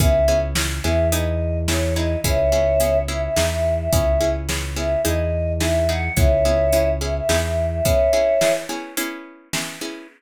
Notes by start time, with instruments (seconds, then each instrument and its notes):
0.00 synth bass 1 C#2, pizzicato strings B3 C#4 E4 G#4, choir aahs E5, kick, closed hi-hat
0.28 pizzicato strings B3 C#4 E4 G#4
0.55 pizzicato strings B3 C#4 E4 G#4, snare
0.84 synth bass 1 E2, pizzicato strings B3 C#4 E4 G#4, choir aahs E5
1.12 pizzicato strings B3 D#4 E4 G#4, choir aahs D#5, closed hi-hat
1.68 pizzicato strings B3 D#4 E4 G#4, choir aahs C#5, snare
1.96 pizzicato strings B3 D#4 E4 G#4, choir aahs D#5
2.24 synth bass 1 C#2, pizzicato strings B3 C#4 E4 G#4, choir aahs C#5 E5, kick, closed hi-hat
2.52 pizzicato strings B3 C#4 E4 G#4
2.80 pizzicato strings B3 C#4 E4 G#4, closed hi-hat
3.08 pizzicato strings B3 C#4 E4 G#4, choir aahs E5
3.22 choir aahs E5
3.36 synth bass 1 E2, pizzicato strings B3 D#4 E4 G#4, snare
3.50 choir aahs E5
3.78 choir aahs E5
3.93 synth bass 1 C#2, pizzicato strings B3 C#4 E4 G#4, choir aahs E5, kick, closed hi-hat
4.21 pizzicato strings B3 C#4 E4 G#4
4.49 pizzicato strings B3 C#4 E4 G#4, snare
4.76 pizzicato strings B3 C#4 E4 G#4, choir aahs E5
5.05 synth bass 1 E2, pizzicato strings B3 D#4 E4 G#4, choir aahs D#5, closed hi-hat
5.60 pizzicato strings B3 D#4 E4 G#4, choir aahs E5, snare
5.89 pizzicato strings B3 D#4 E4 G#4, choir aahs F#5
6.16 synth bass 1 C#2, pizzicato strings B3 C#4 E4 G#4, choir aahs C#5 E5, kick, closed hi-hat
6.45 pizzicato strings B3 C#4 E4 G#4
6.72 pizzicato strings B3 C#4 E4 G#4, closed hi-hat
7.01 pizzicato strings B3 C#4 E4 G#4, choir aahs E5
7.15 choir aahs E5
7.29 synth bass 1 E2, pizzicato strings B3 D#4 E4 G#4, snare
7.43 choir aahs E5
7.71 choir aahs E5
7.85 pizzicato strings B3 C#4 E4 G#4, choir aahs C#5 E5, kick, closed hi-hat
8.13 pizzicato strings B3 C#4 E4 G#4
8.41 pizzicato strings B3 C#4 E4 G#4, snare
8.69 pizzicato strings B3 C#4 E4 G#4
8.97 pizzicato strings B3 C#4 E4 G#4, closed hi-hat
9.53 pizzicato strings B3 C#4 E4 G#4, snare
9.81 pizzicato strings B3 C#4 E4 G#4